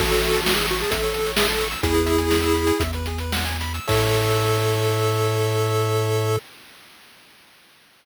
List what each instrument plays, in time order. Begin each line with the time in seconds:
0.00 synth bass 1 A1, lead 1 (square) F#4 A4, kick, crash
0.12 lead 1 (square) C#5, closed hi-hat
0.22 lead 1 (square) E5, closed hi-hat
0.33 lead 1 (square) A5, closed hi-hat
0.44 lead 1 (square) F#4 C#6, snare
0.56 lead 1 (square) G#4 E6, closed hi-hat
0.68 lead 1 (square) F#4 C#6, closed hi-hat
0.80 lead 1 (square) G#4 A5, closed hi-hat
0.91 synth bass 1 A1, lead 1 (square) A4 E5, kick, closed hi-hat
1.03 lead 1 (square) C#5, closed hi-hat
1.14 lead 1 (square) A4, closed hi-hat
1.26 lead 1 (square) C#5, closed hi-hat
1.36 lead 1 (square) G#4 E5, snare
1.48 lead 1 (square) A4 A5, closed hi-hat
1.61 lead 1 (square) C#6, closed hi-hat
1.71 lead 1 (square) E6, closed hi-hat
1.83 synth bass 1 E2, lead 1 (square) E4 G#4, kick, closed hi-hat
1.94 lead 1 (square) B4, closed hi-hat
2.06 lead 1 (square) E5, closed hi-hat
2.18 lead 1 (square) G#5, closed hi-hat
2.30 lead 1 (square) B5, snare
2.42 lead 1 (square) E6, closed hi-hat
2.54 lead 1 (square) B5, closed hi-hat
2.67 lead 1 (square) G#5, closed hi-hat
2.80 synth bass 1 E2, lead 1 (square) E5, kick, closed hi-hat
2.93 lead 1 (square) B4, closed hi-hat
3.06 lead 1 (square) G#4, closed hi-hat
3.18 lead 1 (square) B4, closed hi-hat
3.32 lead 1 (square) F#5, snare
3.45 lead 1 (square) G#5, closed hi-hat
3.60 lead 1 (square) B5, closed hi-hat
3.74 lead 1 (square) E6, closed hi-hat
3.87 synth bass 1 A2, lead 1 (square) A4 C#5 E5, kick, crash